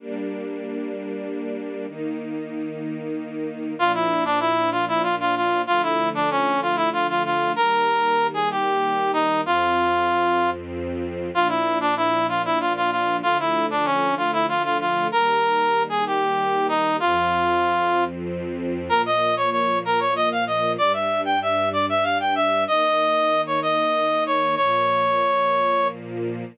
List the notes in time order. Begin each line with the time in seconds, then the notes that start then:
0.00 G3 A#3 D4
1.87 D#3 A#3 D#4
3.77 A#2 F3 D4 F4
3.94 E4
4.25 D4
4.40 E4
4.72 F4
4.88 E4
5.03 F4
5.20 F4
5.36 F4
5.67 D3 F3 A3 F4
5.83 E4
6.15 D4
6.31 C#4
6.62 F4
6.76 E4
6.93 F4
7.09 F4
7.25 F4
7.56 D#3 G3 A#3 A#4
8.34 G#4
8.51 G4
9.13 D#4
9.44 F2 F3 C4 F4
11.34 A#2 F3 D4 F4
11.49 E4
11.81 D4
11.97 E4
12.29 F4
12.45 E4
12.60 F4
12.76 F4
12.91 F4
13.22 D3 F3 A3 F4
13.40 E4
13.70 D4
13.85 C#4
14.17 F4
14.33 E4
14.48 F4
14.64 F4
14.80 F4
15.12 D#3 G3 A#3 A#4
15.89 G#4
16.06 G4
16.68 D#4
17.00 F2 F3 C4 F4
18.89 A#2 F3 A#3 A#4
19.06 D#5
19.37 C#5
19.52 C#5
19.85 A#4
20.00 C#5
20.16 D#5
20.32 F5
20.47 D#5
20.78 G2 G3 D4 D5
20.93 E5
21.25 G5
21.42 E5
21.73 D5
21.89 E5
22.03 F5
22.20 G5
22.35 E5
22.68 D#3 A#3 D#4 D#5
23.47 C#5
23.62 D#5
24.26 C#5
24.56 A#2 F3 A#3 C#5